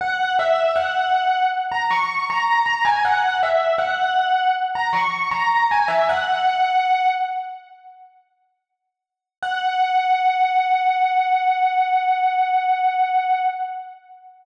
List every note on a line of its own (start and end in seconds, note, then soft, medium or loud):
0.01 0.32 F#5 loud
0.39 0.72 E5 loud
0.76 1.45 F#5 medium
1.72 1.90 A#5 medium
1.91 2.25 C#6 medium
2.30 2.65 A#5 loud
2.66 2.84 A#5 loud
2.85 3.03 G#5 medium
3.05 3.37 F#5 loud
3.43 3.74 E5 medium
3.78 4.51 F#5 medium
4.75 4.93 A#5 medium
4.93 5.28 C#6 medium
5.31 5.67 A#5 medium
5.71 5.89 G#5 medium
5.88 6.06 E5 medium
6.09 7.09 F#5 loud
9.42 13.44 F#5 loud